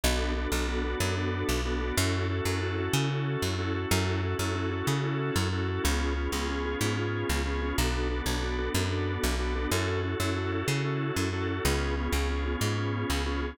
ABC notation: X:1
M:12/8
L:1/8
Q:3/8=124
K:F#m
V:1 name="Drawbar Organ"
[B,DFA]2 [B,DFA] [B,DFA] [B,DFA] [B,DFA] [B,DFA] [B,DFA]3 [B,DFA] [B,DFA] | [CEFA]2 [CEFA] [CEFA] [CEFA] [CEFA] [CEFA] [CEFA]3 [CEFA] [CEFA] | [CEFA]2 [CEFA] [CEFA] [CEFA] [CEFA] [CEFA] [CEFA]3 [CEFA] [CEFA] | [B,C^EG]2 [B,CEG] [B,CEG] [B,CEG] [B,CEG] [B,CEG] [B,CEG]3 [B,CEG] [B,CEG] |
[B,DFA]2 [B,DFA] [B,DFA] [B,DFA] [B,DFA] [B,DFA] [B,DFA]3 [B,DFA] [B,DFA] | [CEFA]2 [CEFA] [CEFA] [CEFA] [CEFA] [CEFA] [CEFA]3 [CEFA] [CEFA] | [B,C^EG]2 [B,CEG] [B,CEG] [B,CEG] [B,CEG] [B,CEG] [B,CEG]3 [B,CEG] [B,CEG] |]
V:2 name="Electric Bass (finger)" clef=bass
B,,,3 B,,,3 F,,3 B,,,3 | F,,3 F,,3 C,3 F,,3 | F,,3 F,,3 C,3 F,,3 | C,,3 C,,3 G,,3 C,,3 |
B,,,3 B,,,3 F,,3 B,,,3 | F,,3 F,,3 C,3 F,,3 | C,,3 C,,3 G,,3 C,,3 |]